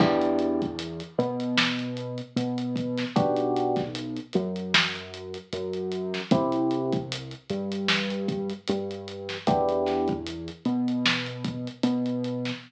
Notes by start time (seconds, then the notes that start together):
0.00 E2 B3 D4 E4 G4, kick, crash
0.22 closed hi-hat
0.39 closed hi-hat
0.62 kick, closed hi-hat
0.79 closed hi-hat
1.00 closed hi-hat
1.18 B2 B3, closed hi-hat
1.40 closed hi-hat
1.58 snare
1.79 closed hi-hat
1.97 closed hi-hat
2.18 closed hi-hat
2.36 B2 B3, closed hi-hat
2.58 closed hi-hat
2.76 kick, closed hi-hat
2.98 snare, closed hi-hat
3.16 B1 B3 D4 F#4 G4, kick, closed hi-hat
3.37 closed hi-hat
3.56 closed hi-hat
3.76 kick, snare, closed hi-hat
3.95 closed hi-hat
4.16 closed hi-hat
4.33 F#2 F#3, closed hi-hat
4.56 closed hi-hat
4.74 snare
4.95 closed hi-hat
5.14 closed hi-hat
5.34 closed hi-hat
5.53 F#2 F#3, closed hi-hat
5.73 closed hi-hat
5.92 closed hi-hat
6.14 snare, closed hi-hat
6.31 C2 C4 E4 G4, kick, closed hi-hat
6.52 closed hi-hat
6.71 closed hi-hat
6.92 kick, closed hi-hat
7.12 closed hi-hat
7.31 closed hi-hat
7.50 G2 G3, closed hi-hat
7.72 closed hi-hat
7.88 snare
8.10 closed hi-hat
8.28 kick, closed hi-hat
8.50 closed hi-hat
8.68 G2 G3, closed hi-hat
8.91 closed hi-hat
9.08 closed hi-hat
9.29 snare, closed hi-hat
9.47 E2 B3 D4 E4 G4, kick, closed hi-hat
9.69 closed hi-hat
9.86 snare, closed hi-hat
10.08 kick, closed hi-hat
10.26 closed hi-hat
10.48 closed hi-hat
10.65 B2 B3, closed hi-hat
10.88 closed hi-hat
11.06 snare
11.26 closed hi-hat
11.44 kick, closed hi-hat
11.67 closed hi-hat
11.83 B2 B3, closed hi-hat
12.06 closed hi-hat
12.24 closed hi-hat
12.45 snare, closed hi-hat